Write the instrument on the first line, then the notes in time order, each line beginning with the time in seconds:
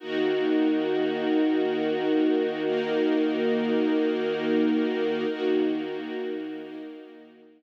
string ensemble 1
0.00 D#3 A#3 D#4 F#4 A#4
2.65 A#3 D#4 A#4
5.29 D#3 A#3 D#4 F#4 A#4
6.60 A#3 D#4 A#4